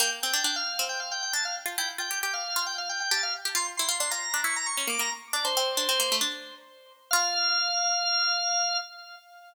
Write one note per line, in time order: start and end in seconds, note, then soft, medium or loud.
0.00 0.20 A#3 medium
0.00 0.10 G5 medium
0.22 0.34 C4 medium
0.22 0.43 G5 medium
0.34 0.44 D4 medium
0.44 0.63 D4 medium
0.44 0.55 G5 medium
0.56 0.85 F5 medium
0.79 1.33 C4 medium
0.89 0.99 G5 medium
1.00 1.10 F5 medium
1.11 1.22 G5 medium
1.22 1.33 G5 medium
1.33 1.64 D4 medium
1.33 1.44 A5 medium
1.45 1.55 F5 medium
1.66 1.76 F4 medium
1.78 1.97 E4 medium
1.78 1.89 G5 medium
1.98 2.09 F4 medium
1.98 2.19 G5 medium
2.11 2.21 G4 medium
2.23 2.43 G4 medium
2.23 2.33 G5 medium
2.33 2.64 F5 medium
2.56 3.02 F4 medium
2.66 2.77 G5 medium
2.78 2.88 F5 medium
2.89 2.99 G5 medium
3.00 3.10 G5 medium
3.11 3.38 G4 medium
3.11 3.21 A5 medium
3.23 3.33 F5 medium
3.45 3.56 G4 medium
3.55 3.76 F4 medium
3.55 3.67 C6 medium
3.77 3.90 E4 medium
3.77 3.96 C6 medium
3.89 3.99 F4 medium
3.99 4.11 D4 medium
3.99 4.10 C6 medium
4.11 4.29 F4 medium
4.11 4.40 A#5 medium
4.34 4.44 D4 medium
4.44 4.74 E4 medium
4.44 4.55 C#6 medium
4.56 4.67 A#5 medium
4.66 4.77 C#6 medium
4.77 4.88 C#4 medium
4.77 4.88 C#6 medium
4.87 4.98 A#3 medium
4.87 5.00 D6 medium
4.99 5.10 A#3 medium
4.99 5.11 A#5 medium
5.33 5.44 D4 medium
5.33 5.44 D5 medium
5.44 5.55 D4 medium
5.44 6.16 C5 medium
5.57 5.77 C4 medium
5.77 5.88 D4 medium
5.89 5.99 C4 medium
6.00 6.10 A#3 medium
6.12 6.22 A3 medium
6.21 7.02 D4 medium
7.11 8.80 F4 loud
7.11 8.77 F5 loud